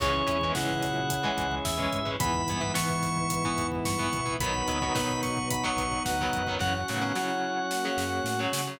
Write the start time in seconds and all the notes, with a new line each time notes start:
0.00 C#2 E3 G#3 C#4 E4 G#4 C#5 E5 G#5, kick, crash
0.14 kick
0.27 E2 E3 G#3 C#4 E4, kick, closed hi-hat
0.41 D#3 E3 G#3 B3 C#4, kick
0.55 G#2 C#3 E3 G#3 C#4 F#5, kick, snare
0.69 kick
0.82 A#2 F#3, kick, snare, closed hi-hat
0.96 kick
1.10 kick, closed hi-hat
1.23 E3 G#3 C#4, kick
1.38 C#2, kick, closed hi-hat
1.51 kick
1.65 E2 E5, kick, snare
1.77 E3 G#3 C#4, kick
1.93 G#2, kick, closed hi-hat
2.05 E3 G#3 C#4, kick
2.20 E2 G#2 E3 B3 E4 B4 E5 B5, kick, closed hi-hat
2.34 kick
2.48 G2 E3 B3, kick, closed hi-hat
2.61 E3 B3, kick
2.74 E3 B3 C#6, kick, snare
2.89 kick
3.03 kick, snare, closed hi-hat
3.17 kick
3.30 kick, closed hi-hat
3.44 E3 B3, kick
3.58 E2, kick, closed hi-hat
3.72 kick
3.85 G2 C#6, kick, snare
3.98 E3 B3, kick
4.13 B2, kick, closed hi-hat
4.26 E3 B3, kick
4.40 B1 D#3 F#3 B3 D#4 F#4 B4 D#5 F#5 B5, kick, closed hi-hat
4.54 kick
4.67 D2 D#3 F#3 B3, kick, closed hi-hat
4.82 D#3 F#3 B3, kick
4.95 B2 D#3 F#3 B3, kick, snare
5.09 kick
5.23 C#6, kick, snare, closed hi-hat
5.37 kick
5.50 B5, kick, closed hi-hat
5.64 D#3 F#3 B3 C#6, kick
5.76 B1, kick, closed hi-hat
5.92 kick
6.05 D2 F#5, kick, snare
6.19 D#3 F#3 B3, kick
6.33 F#2, kick, closed hi-hat
6.47 D#3 F#3 B3, kick
6.59 F#2 C#3 E3 F#3 C#4 F#4 C#5 F#5, kick, snare
6.75 F#5
6.88 A2 C#3 D#3 F#3 B3, snare
7.01 C#3 F#3
7.15 C#3 F#3 E4 C#5, snare
7.71 A#3 F#4, snare
7.85 C#3 F#3
7.97 F#2, snare
8.24 A2, snare
8.39 C#3 F#3
8.53 C#3, snare
8.67 C#3 F#3